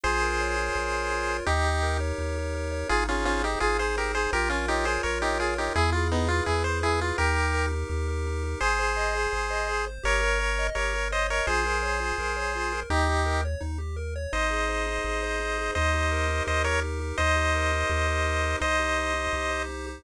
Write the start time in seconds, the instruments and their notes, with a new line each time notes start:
0.03 synth bass 1 A#1, lead 1 (square) F4 G#4 C5
0.22 lead 1 (square) A#4
0.41 lead 1 (square) C#5
0.57 lead 1 (square) F4
0.76 synth bass 1 A#1, lead 1 (square) A#4
0.93 lead 1 (square) C#5
1.12 lead 1 (square) F4
1.29 lead 1 (square) A#4
1.46 synth bass 1 D#2, lead 1 (square) D#4 G4
1.65 lead 1 (square) G4
1.83 lead 1 (square) A#4
2.00 lead 1 (square) C#5
2.18 synth bass 1 D#2, lead 1 (square) D#4
2.36 lead 1 (square) G4
2.55 lead 1 (square) A#4
2.72 lead 1 (square) C#5
2.89 synth bass 1 G#1, lead 1 (square) D#4 F4 G#4
3.08 lead 1 (square) C#4 F4 G#4
3.25 lead 1 (square) C#4 F4 C5
3.43 lead 1 (square) D#4 G4
3.60 synth bass 1 G#1, lead 1 (square) F4 G#4
3.79 lead 1 (square) G#4 C5
3.97 lead 1 (square) D#4 G4 A#4
4.15 lead 1 (square) G#4 C5
4.33 synth bass 1 A#1, lead 1 (square) F4 G4 A#4
4.49 lead 1 (square) C#4 F4 A#4
4.68 lead 1 (square) D#4 G4 C#5
4.85 lead 1 (square) F4 G#4 C5
5.03 synth bass 1 A#1, lead 1 (square) A#4 C#5
5.22 lead 1 (square) D#4 G4 C#5
5.40 lead 1 (square) F4 G#4
5.58 lead 1 (square) D#4 G4 A#4
5.74 synth bass 1 E2, lead 1 (square) E4 G#4
5.92 lead 1 (square) F4 G#4
6.12 lead 1 (square) B3 D#4 B4
6.28 lead 1 (square) E4 F4
6.46 synth bass 1 E2, lead 1 (square) E4 G#4
6.64 lead 1 (square) B4 C5
6.82 lead 1 (square) E4 G#4
7.00 lead 1 (square) F4 G#4
7.18 synth bass 1 D#2, lead 1 (square) D#4 G4 A#4
7.36 lead 1 (square) G4
7.54 lead 1 (square) A#4
7.72 lead 1 (square) D#4
7.89 synth bass 1 D#2, lead 1 (square) G4
8.08 lead 1 (square) A#4
8.27 lead 1 (square) D#4
8.44 lead 1 (square) G4
8.60 synth bass 1 G#1, lead 1 (square) G#4 C5
8.79 lead 1 (square) C5
8.97 lead 1 (square) D#5
9.15 lead 1 (square) G#4
9.32 synth bass 1 G#1, lead 1 (square) C5
9.50 lead 1 (square) D#5
9.69 lead 1 (square) G#4
9.87 lead 1 (square) C5
10.03 synth bass 1 G1, lead 1 (square) G4 A#4 C#5
10.21 lead 1 (square) A#4
10.40 lead 1 (square) C#5
10.59 lead 1 (square) D#5
10.75 synth bass 1 G1, lead 1 (square) G4 A#4 C#5
10.94 lead 1 (square) A#4
11.12 lead 1 (square) C5 C#5 D#5
11.30 lead 1 (square) A#4 C#5 D#5
11.47 synth bass 1 A#1, lead 1 (square) F4 G#4 C5
11.66 lead 1 (square) A#4
11.83 lead 1 (square) C#5
12.00 lead 1 (square) F4
12.18 synth bass 1 A#1, lead 1 (square) A#4
12.37 lead 1 (square) C#5
12.55 lead 1 (square) F4
12.72 lead 1 (square) A#4
12.90 synth bass 1 D#2, lead 1 (square) D#4 G4
13.07 lead 1 (square) G4
13.26 lead 1 (square) A#4
13.45 lead 1 (square) C#5
13.61 synth bass 1 D#2, lead 1 (square) D#4
13.78 lead 1 (square) G4
13.96 lead 1 (square) A#4
14.16 lead 1 (square) C#5
14.33 synth bass 1 G#1, lead 1 (square) D#4 C5 D#5
14.50 lead 1 (square) G#4
14.69 lead 1 (square) C5
14.87 lead 1 (square) D#4
15.04 synth bass 1 G#1, lead 1 (square) G#4
15.23 lead 1 (square) C5
15.40 lead 1 (square) D#4
15.58 lead 1 (square) G#4
15.75 synth bass 1 D#2, lead 1 (square) D#4 C5 D#5
15.94 lead 1 (square) G4
16.11 lead 1 (square) A#4
16.28 lead 1 (square) D#4
16.46 synth bass 1 D#2, lead 1 (square) G4 C5 D#5
16.64 lead 1 (square) A#4 C#5
16.83 lead 1 (square) D#4
17.00 lead 1 (square) G4
17.18 synth bass 1 D#2, lead 1 (square) D#4 C5 D#5
17.36 lead 1 (square) G4
17.54 lead 1 (square) A#4
17.73 lead 1 (square) D#4
17.89 synth bass 1 D#2, lead 1 (square) G4
18.07 lead 1 (square) A#4
18.26 lead 1 (square) D#4
18.43 lead 1 (square) G4
18.60 synth bass 1 C2, lead 1 (square) D#4 C5 D#5
18.79 lead 1 (square) G4
18.98 lead 1 (square) C5
19.14 lead 1 (square) D#4
19.33 synth bass 1 C2, lead 1 (square) G4
19.51 lead 1 (square) C5
19.69 lead 1 (square) D#4
19.87 lead 1 (square) G4